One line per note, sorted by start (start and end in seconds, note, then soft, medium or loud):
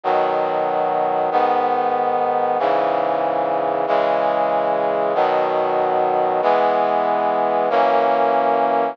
0.04 1.30 B2 medium
0.04 1.30 D#3 medium
0.04 1.30 F#3 medium
1.31 2.58 G#2 medium
1.31 2.58 D#3 medium
1.31 2.58 B3 medium
2.59 3.86 G#2 medium
2.59 3.86 C#3 medium
2.59 3.86 E3 medium
3.87 5.14 C#3 medium
3.87 5.14 E3 medium
3.87 5.14 G#3 medium
5.15 6.41 B2 medium
5.15 6.41 D#3 medium
5.15 6.41 F#3 medium
6.42 7.69 E3 medium
6.42 7.69 G#3 medium
6.42 7.69 B3 medium
7.70 8.96 F#2 medium
7.70 8.96 E3 medium
7.70 8.96 A#3 medium
7.70 8.96 C#4 medium